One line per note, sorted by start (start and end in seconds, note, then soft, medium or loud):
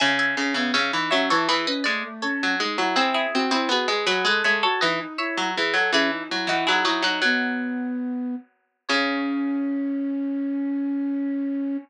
0.00 0.35 C#3 loud
0.00 0.17 E5 loud
0.00 0.17 G#5 loud
0.19 0.50 E5 medium
0.19 0.50 G#5 loud
0.37 0.54 C#3 medium
0.37 0.54 C#4 medium
0.54 0.72 C#3 medium
0.54 0.73 B3 medium
0.54 0.73 E5 medium
0.54 0.73 G#5 loud
0.74 0.92 C#3 medium
0.74 0.91 C#4 medium
0.74 1.04 C#5 medium
0.74 1.04 E5 loud
0.92 1.11 E3 medium
0.92 1.10 D#4 medium
1.10 1.29 F#3 medium
1.10 1.29 C#4 medium
1.10 1.28 C#5 medium
1.10 1.28 E5 loud
1.30 1.48 E3 medium
1.30 1.47 E4 medium
1.30 1.48 A4 loud
1.30 1.48 C#5 loud
1.48 1.66 E3 medium
1.48 1.66 E4 medium
1.48 1.66 G#4 medium
1.48 1.66 B4 loud
1.67 1.84 C#4 medium
1.67 1.85 B4 medium
1.67 1.85 D#5 medium
1.84 2.03 G#3 medium
1.84 2.03 A3 medium
1.84 2.14 D5 loud
2.04 2.22 A3 medium
2.22 2.55 C#4 medium
2.22 2.91 A4 medium
2.22 2.91 C#5 medium
2.43 2.61 F#3 medium
2.59 2.77 G#3 medium
2.59 2.77 D#4 medium
2.78 2.96 F#3 medium
2.78 2.96 E4 medium
2.96 3.26 C4 loud
2.96 3.13 E4 loud
2.96 3.13 G#4 loud
3.14 3.45 E4 loud
3.14 3.45 G#4 loud
3.33 3.51 C4 medium
3.33 3.51 F#4 medium
3.51 3.69 C4 medium
3.51 3.69 E4 medium
3.51 3.69 G#4 loud
3.69 3.86 B3 medium
3.69 3.88 F#4 medium
3.69 4.03 G#4 medium
3.69 4.03 B4 loud
3.88 4.06 G#3 medium
3.88 4.07 G#4 medium
4.06 4.24 F#3 medium
4.06 4.25 F#4 medium
4.06 4.24 G#4 medium
4.06 4.24 B4 loud
4.25 4.42 G#3 medium
4.25 4.43 A4 medium
4.25 4.44 B4 medium
4.25 4.44 D#5 loud
4.44 4.63 G#3 medium
4.44 4.62 A4 medium
4.44 4.62 C#5 loud
4.44 4.62 E5 loud
4.63 4.81 F#4 medium
4.63 4.81 A4 loud
4.63 4.81 C#5 loud
4.81 5.00 E3 medium
4.81 4.99 D#4 medium
4.81 5.16 B4 medium
4.81 5.16 D#5 medium
5.00 5.18 D#4 medium
5.18 5.50 E4 medium
5.18 5.90 C#5 loud
5.18 5.90 E5 loud
5.38 5.55 F#3 medium
5.56 5.75 E3 medium
5.56 5.74 G#4 medium
5.73 5.91 F#3 medium
5.73 5.91 A4 medium
5.92 6.23 E3 medium
5.92 6.10 C#4 medium
5.92 6.11 E4 loud
5.92 6.11 G#4 loud
6.12 6.29 D#4 medium
6.29 6.49 F#3 medium
6.29 6.46 E4 medium
6.47 6.65 E3 medium
6.47 6.66 D#4 loud
6.47 6.67 E4 medium
6.47 6.66 F#4 loud
6.67 6.84 F#3 medium
6.67 6.84 D#4 medium
6.67 6.84 E4 loud
6.67 6.84 G#4 loud
6.85 7.02 F#3 medium
6.85 7.02 D#4 medium
6.85 7.02 E4 medium
6.85 7.02 F#4 loud
7.02 7.20 F#3 medium
7.02 7.21 D#4 medium
7.02 8.43 D#4 loud
7.02 8.43 F#4 loud
7.22 8.80 F#3 medium
7.22 8.35 B3 medium
8.89 11.77 C#3 loud
8.89 11.77 C#4 loud
8.89 11.76 C#5 loud